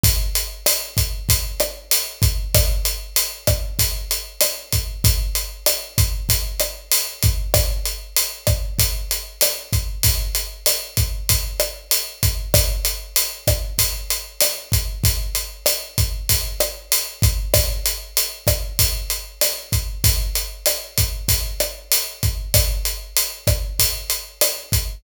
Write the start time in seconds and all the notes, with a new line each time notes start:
0.04 kick, closed hi-hat
0.35 closed hi-hat
0.66 cross-stick, closed hi-hat
0.97 kick, closed hi-hat
1.29 kick, closed hi-hat
1.60 cross-stick, closed hi-hat
1.91 closed hi-hat
2.22 kick, closed hi-hat
2.55 kick, cross-stick, closed hi-hat
2.85 closed hi-hat
3.16 closed hi-hat
3.47 kick, cross-stick, closed hi-hat
3.79 kick, closed hi-hat
4.11 closed hi-hat
4.41 cross-stick, closed hi-hat
4.73 kick, closed hi-hat
5.04 kick, closed hi-hat
5.35 closed hi-hat
5.66 cross-stick, closed hi-hat
5.98 kick, closed hi-hat
6.29 kick, closed hi-hat
6.60 cross-stick, closed hi-hat
6.92 closed hi-hat
7.23 kick, closed hi-hat
7.54 kick, cross-stick, closed hi-hat
7.86 closed hi-hat
8.17 closed hi-hat
8.47 kick, cross-stick, closed hi-hat
8.79 kick, closed hi-hat
9.11 closed hi-hat
9.41 cross-stick, closed hi-hat
9.73 kick, closed hi-hat
10.03 kick, closed hi-hat
10.35 closed hi-hat
10.66 cross-stick, closed hi-hat
10.97 kick, closed hi-hat
11.29 kick, closed hi-hat
11.60 cross-stick, closed hi-hat
11.91 closed hi-hat
12.23 kick, closed hi-hat
12.54 kick, cross-stick, closed hi-hat
12.85 closed hi-hat
13.16 closed hi-hat
13.47 kick, cross-stick, closed hi-hat
13.79 kick, closed hi-hat
14.10 closed hi-hat
14.41 cross-stick, closed hi-hat
14.72 kick, closed hi-hat
15.04 kick, closed hi-hat
15.35 closed hi-hat
15.66 cross-stick, closed hi-hat
15.98 kick, closed hi-hat
16.29 kick, closed hi-hat
16.60 cross-stick, closed hi-hat
16.92 closed hi-hat
17.22 kick, closed hi-hat
17.54 kick, cross-stick, closed hi-hat
17.86 closed hi-hat
18.17 closed hi-hat
18.47 kick, cross-stick, closed hi-hat
18.79 kick, closed hi-hat
19.10 closed hi-hat
19.41 cross-stick, closed hi-hat
19.72 kick, closed hi-hat
20.04 kick, closed hi-hat
20.35 closed hi-hat
20.66 cross-stick, closed hi-hat
20.98 kick, closed hi-hat
21.29 kick, closed hi-hat
21.60 cross-stick, closed hi-hat
21.92 closed hi-hat
22.23 kick, closed hi-hat
22.54 kick, cross-stick, closed hi-hat
22.85 closed hi-hat
23.17 closed hi-hat
23.47 kick, cross-stick, closed hi-hat
23.79 kick, closed hi-hat
24.10 closed hi-hat
24.41 cross-stick, closed hi-hat
24.72 kick, closed hi-hat